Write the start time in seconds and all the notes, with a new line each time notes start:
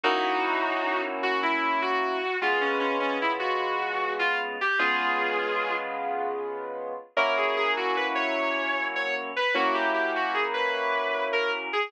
0.04 F#3 A#3 C#4 D#4 E4 F#4
1.23 F#4
1.43 E4
1.82 F#4
2.42 C#3 G#3 B3 F4
2.61 C#4
2.80 C#4
3.00 C#4
3.22 E4
3.39 F#4
4.19 F4
4.61 G4
4.79 C#3 G#3 B3 F4 G#4
7.17 F#3 A#3 C#4 E4 A#4
7.37 G#4
7.57 G#4
7.77 F#4
7.97 B4
8.15 C#5
8.96 C#5
9.36 B4
9.55 F#3 A#3 C#4 E4 F#4
9.74 G4
9.94 G4
10.16 F#4
10.34 G#4
10.54 B4
11.33 A#4
11.73 G#4